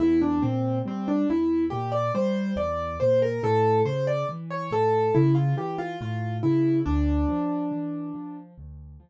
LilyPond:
<<
  \new Staff \with { instrumentName = "Acoustic Grand Piano" } { \time 4/4 \key d \minor \tempo 4 = 70 e'16 d'16 c'8 c'16 d'16 e'8 g'16 d''16 c''8 d''8 c''16 bes'16 | a'8 c''16 d''16 r16 cis''16 a'8 e'16 f'16 g'16 f'16 f'8 e'8 | d'2 r2 | }
  \new Staff \with { instrumentName = "Acoustic Grand Piano" } { \clef bass \time 4/4 \key d \minor e,8 bes,8 g8 e,8 bes,8 g8 e,8 bes,8 | a,8 cis8 e8 a,8 cis8 e8 a,8 cis8 | d,8 f8 e8 f8 d,8 f8 r4 | }
>>